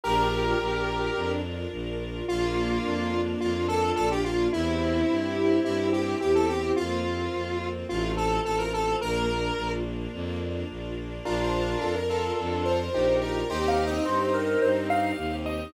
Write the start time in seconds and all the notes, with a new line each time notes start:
0.04 A#1 D4 F4 G4 A#4
0.32 F4
0.59 A#1 A#4
0.88 F4
1.16 F2 D4
1.44 F4
1.72 A#1 A#4
2.00 F4
2.28 A#1 A#3 D4 F4
2.56 D4
2.84 F2 F4
3.12 A#3
3.40 F2 D4 F4
3.68 F4 A4
3.96 A#1 A#3 A4
4.11 G4
4.24 D4 F4
4.52 E2 C4 E4 G4
4.80 E4
5.09 G2 G4
5.37 C4
5.64 G2 E4
5.93 G4
6.21 E2 C4 G4
6.35 A4
6.49 E4 G4
6.76 F2 A#3 C4 F4
7.04 C4
7.32 F2 F4
7.61 C4
7.88 A1 A3 C4 F4
8.17 C4 A4
8.44 A1 F4 A4
8.58 A#4
8.73 C4 A4
9.01 A#1 A#3 D4 F4 A#4
9.29 D4
9.57 A#1 F4
9.85 D4
10.13 F2 A#3
10.42 D4
10.69 A#1 F4
10.98 D4
11.25 A#1 D4 F4 A#4
11.44 C5
11.53 F4
11.63 A#4
11.81 F2 A4 A#4
11.96 A#4
12.09 F4 A4 A#4
12.37 F2 D4
12.66 F4 C5
12.93 A#1 D#4 G4 A#4
13.22 F4 A#4
13.49 D#2 C4 D#4 G4 C5
13.68 F5
13.78 D#4
13.87 D#5
13.92 C4 D#4
14.05 G2 G4 C5
14.20 C5
14.33 D#4 A#4
14.62 G2 C4 C5
14.90 D#4 F5
15.17 D#2 G4
15.46 D#4 D#5